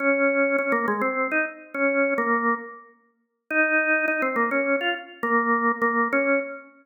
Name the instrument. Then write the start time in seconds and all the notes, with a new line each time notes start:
drawbar organ
0.00 C#4
0.58 C#4
0.72 A#3
0.88 G#3
1.01 C4
1.32 D#4
1.74 C#4
2.18 A#3
3.50 D#4
4.08 D#4
4.22 C4
4.36 A#3
4.51 C#4
4.81 F4
5.23 A#3
5.82 A#3
6.12 C#4